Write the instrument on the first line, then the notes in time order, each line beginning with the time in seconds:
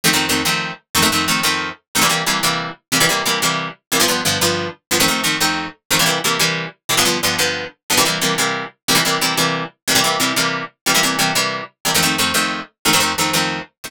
acoustic guitar (steel)
0.04 F2 D#3 A3 C4
0.13 F2 D#3 A3 C4
0.29 F2 D#3 A3 C4
0.45 F2 D#3 A3 C4
0.95 F2 D#3 A3 C4
1.02 F2 D#3 A3 C4
1.12 F2 D#3 A3 C4
1.28 F2 D#3 A3 C4
1.43 F2 D#3 A3 C4
1.95 F2 D#3 A3 C4
2.01 C3 E3 G3 A#3
2.09 C3 E3 G3 A#3
2.26 C3 E3 G3 A#3
2.43 C3 E3 G3 A#3
2.92 C3 E3 G3 A#3
3.00 C3 E3 G3 A#3
3.09 C3 E3 G3 A#3
3.26 C3 E3 G3 A#3
3.42 C3 E3 G3 A#3
3.92 C3 E3 G3 A#3
4.00 G2 D3 F3 B3
4.08 G2 D3 F3 B3
4.25 G2 D3 F3 B3
4.41 G2 D3 F3 B3
4.91 G2 D3 F3 B3
5.00 F2 D#3 A3 C4
5.08 F2 D#3 A3 C4
5.24 F2 D#3 A3 C4
5.40 F2 D#3 A3 C4
5.91 F2 D#3 A3 C4
5.99 C3 E3 G3 A#3
6.06 C3 E3 G3 A#3
6.24 C3 E3 G3 A#3
6.39 C3 E3 G3 A#3
6.89 C3 E3 G3 A#3
6.97 G2 D3 F3 B3
7.05 G2 D3 F3 B3
7.23 G2 D3 F3 B3
7.38 G2 D3 F3 B3
7.90 G2 D3 F3 B3
7.97 C3 E3 G3 A#3
8.05 C3 E3 G3 A#3
8.21 C3 E3 G3 A#3
8.38 C3 E3 G3 A#3
8.88 C3 E3 G3 A#3
8.95 C3 E3 G3 A#3
9.05 C3 E3 G3 A#3
9.21 C3 E3 G3 A#3
9.37 C3 E3 G3 A#3
9.88 C3 E3 G3 A#3
9.95 C3 E3 G3 A#3
10.04 C3 E3 G3 A#3
10.20 C3 E3 G3 A#3
10.36 C3 E3 G3 A#3
10.86 C3 E3 G3 A#3
10.94 C3 E3 G3 A#3
11.03 C3 E3 G3 A#3
11.19 C3 E3 G3 A#3
11.35 C3 E3 G3 A#3
11.85 C3 E3 G3 A#3
11.94 F2 D#3 A3 C4
12.02 F2 D#3 A3 C4
12.18 F2 D#3 A3 C4
12.34 F2 D#3 A3 C4
12.85 F2 D#3 A3 C4
12.93 F2 D#3 A3 C4
13.00 F2 D#3 A3 C4
13.18 F2 D#3 A3 C4
13.33 F2 D#3 A3 C4
13.84 F2 D#3 A3 C4